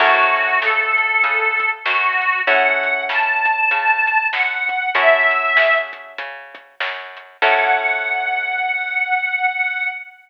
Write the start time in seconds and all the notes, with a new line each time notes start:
0.00 F#2 C#4 E4 F#4 A4, kick, crash
0.36 closed hi-hat
0.61 C#3 A4, snare
0.98 closed hi-hat
1.24 C#3, kick, closed hi-hat
1.60 kick, closed hi-hat
1.85 F#2 F#4, snare
2.22 closed hi-hat
2.46 F#2 C#4 E4 F#4 A4 F#5, kick, closed hi-hat
2.83 closed hi-hat
3.09 C#3 A5, snare
3.45 kick, closed hi-hat
3.71 C#3, kick, closed hi-hat
4.07 closed hi-hat
4.33 F#2 F#5, snare
4.69 kick, closed hi-hat
4.95 F#2 C#4 E4 F#4 A4 E5, kick, closed hi-hat
5.31 closed hi-hat
5.57 C#3, snare
5.93 kick, closed hi-hat
6.18 C#3, kick, closed hi-hat
6.55 kick, closed hi-hat
6.80 F#2, snare
7.17 closed hi-hat
7.42 F#2 C#4 E4 F#4 A4 F#5, kick, crash